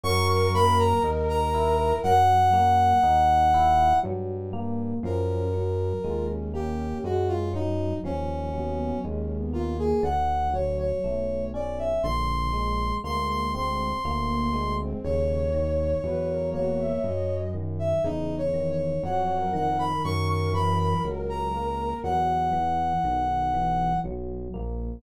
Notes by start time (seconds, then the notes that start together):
0.04 F#2 F#3 A#4 C#6
0.28 C#6
0.54 A#3 B5
0.79 A#5
1.03 D#2 D#4
1.29 A#5
1.54 E4
2.03 F#2 F#3 F#5
2.53 A#3
3.03 D#2 D#4
3.54 E4
4.03 G2 F#3
4.53 A#3
5.03 F#2 F3 C#4 A#4
5.54 F#3
6.04 D#2 G#3 F4
6.29 C#4
6.54 A#3 G4
7.03 F#2 G#3 F#4
7.28 F4
7.53 F#3 D#4
8.03 D#2 F3 C#4
8.53 F#3 B3
9.04 D#2 G#3 C#4
9.37 B3
9.53 A#3 F4
9.70 A#3
9.79 G#4
10.03 D2 D3 F#5
10.53 F#3 C#5
10.79 C#5
11.04 B1 A3
11.54 C#4 D5
11.78 E5
12.03 A#1 D3 C6
12.53 G#3
13.04 D2 G#3 A#3 C6
13.29 C6
13.53 C4 C6
14.04 D2 A#3
14.29 A#3
14.54 G#3
14.79 C4
15.04 D#2 C#3 C#5
15.54 D#3
16.03 E2 F#3 B4
16.29 A#4
16.54 A#3 F#4 C#5
16.79 E5
17.03 F#2 F#3 D#5
17.54 D#3
17.79 E5
18.04 E2 C#3 D#4
18.38 C#5
18.54 D#3
18.71 C#5
19.03 F2 F#3 C#5 F#5
19.37 A#4
19.53 D#3 F#5
19.70 A#4
19.79 B5
20.04 F#2 A#4 C#6
20.29 C#6
20.53 E3 B5
20.79 B5
21.04 C#2 F#3
21.29 A#5
21.54 A#3
22.04 E2 F#3 F#5
22.53 E3
23.04 B1 D#3
23.54 E3
24.04 B1 F#3
24.54 A#1 A#3